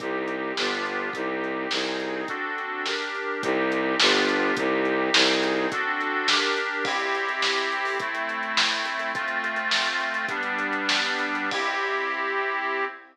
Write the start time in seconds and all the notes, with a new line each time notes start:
0.00 C2 C4 D#4 G4, kick, closed hi-hat
0.28 closed hi-hat
0.57 G1 B3 D4 F4 G4, snare
0.86 closed hi-hat
1.13 C2 C4 D#4 G4, kick, closed hi-hat
1.44 closed hi-hat
1.71 C2 C4 D#4 G#4, snare
2.00 closed hi-hat
2.28 C4 D4 F#4 A4, kick, closed hi-hat
2.58 closed hi-hat
2.86 D4 G4 A#4, snare
3.15 closed hi-hat
3.43 C2 C4 D#4 G4, kick, closed hi-hat
3.72 closed hi-hat
4.00 G1 B3 D4 F4 G4, snare
4.28 closed hi-hat
4.57 C2 C4 D#4 G4, kick, closed hi-hat
4.85 closed hi-hat
5.14 C2 C4 D#4 G#4, snare
5.43 closed hi-hat
5.72 C4 D4 F#4 A4, kick, closed hi-hat
6.01 closed hi-hat
6.28 D4 G4 A#4, snare
6.57 closed hi-hat
6.85 C4 E4 G4, kick, crash
7.00 closed hi-hat
7.15 closed hi-hat
7.29 closed hi-hat
7.42 snare
7.57 closed hi-hat
7.72 closed hi-hat
7.85 open hi-hat
7.99 A3 C4 E4, kick, closed hi-hat
8.15 closed hi-hat
8.29 closed hi-hat
8.43 closed hi-hat
8.57 snare
8.72 closed hi-hat
8.85 closed hi-hat
8.99 closed hi-hat
9.14 A3 C4 F4, kick, closed hi-hat
9.28 closed hi-hat
9.44 closed hi-hat
9.56 closed hi-hat
9.71 snare
9.86 closed hi-hat
10.00 closed hi-hat
10.14 closed hi-hat
10.29 G3 B3 D4, kick, closed hi-hat
10.43 closed hi-hat
10.59 closed hi-hat
10.73 closed hi-hat
10.89 snare
11.04 closed hi-hat
11.19 closed hi-hat
11.35 closed hi-hat
11.51 C4 E4 G4, kick, crash